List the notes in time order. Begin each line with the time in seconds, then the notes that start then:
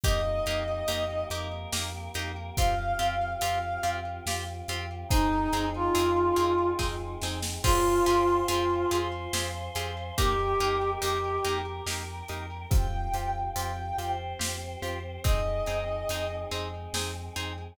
0.04 F2 A#3 D#4 G4 D#5, kick, closed hi-hat
0.46 F2 A#3 D#4 G4, closed hi-hat
0.88 F2 A#3 D#4 G4, closed hi-hat
1.30 F2 A#3 D#4 G4 A#4, closed hi-hat
1.73 F2 A#3 D#4 G4, snare
2.14 F2 A#3 D#4 G4, closed hi-hat
2.57 F2 C4 F4 G4 F5, kick, closed hi-hat
2.99 F2 C4 F4 G4, closed hi-hat
3.41 F2 C4 F4 G4 F5, closed hi-hat
3.83 F2 C4 F4 G4, closed hi-hat
4.26 F2 C4 F4 G4, snare
4.68 F2 C4 F4 G4, closed hi-hat
5.09 F2 C4 D#4 G#4, kick, closed hi-hat
5.53 F2 C4 D#4 G#4, closed hi-hat
5.75 F4
5.95 F2 C4 D#4 G#4, closed hi-hat
6.36 F2 C4 D#4 G#4, closed hi-hat
6.79 F2 C4 D#4 G#4, kick, snare
7.22 F2 C4 D#4 G#4, snare
7.42 snare
7.63 F2 C4 F4 G4 G#4 C5 F5 G5 G#5, kick, crash
8.06 F2 C4 F4 G4 G#4, closed hi-hat
8.47 F2 C4 F4 G4 G#4, closed hi-hat
8.91 F2 C4 F4 G4 G#4 C5 F5 G#5 C6, closed hi-hat
9.33 F2 C4 F4 G4 G#4, snare
9.75 F2 C4 F4 G4 G#4, closed hi-hat
10.17 F2 A#3 D#4 G4 A#4 D#5 G5, kick, closed hi-hat
10.60 F2 A#3 D#4 G4, closed hi-hat
11.01 F2 A#3 D#4 G4, closed hi-hat
11.44 F2 A#3 D#4 G4 A#4 G5 A#5, closed hi-hat
11.86 F2 A#3 D#4 G4, snare
12.29 F2 A#3 D#4 G4, closed hi-hat
12.71 F2 C4 F4 G4 G5, kick, closed hi-hat
13.13 F2 C4 F4 G4, closed hi-hat
13.56 F2 C4 F4 G4 G5, closed hi-hat
13.98 F2 C4 F4 G4 C5, closed hi-hat
14.39 F2 C4 F4 G4, snare
14.82 F2 C4 F4 G4, closed hi-hat
15.24 F2 C4 D#4 G#4 D#5, kick, closed hi-hat
15.66 F2 C4 D#4 G#4, closed hi-hat
16.09 F2 C4 D#4 G#4, closed hi-hat
16.51 F2 G#3 C4 D#4 G#4, closed hi-hat
16.93 F2 C4 D#4 G#4, snare
17.36 F2 C4 D#4 G#4, closed hi-hat